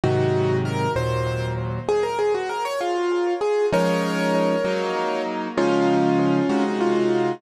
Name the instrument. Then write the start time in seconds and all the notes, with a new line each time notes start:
acoustic grand piano
0.04 G#2 C3 D#3 F#3 D#4 F#4
0.65 A#4
0.96 D#2 A#2 F#3 C5
1.89 G#4
2.03 A#4
2.19 G#4
2.34 F#4
2.49 A#4
2.65 C#5
2.81 F4
3.41 G#4
3.72 F3 G#3 C#4 D#4 A#4 C#5
4.65 F#3 A#3 D#4
5.57 C#3 F3 G#3 C#4 D#4 F4
6.49 C3 G#3 D#4 F#4
6.81 F4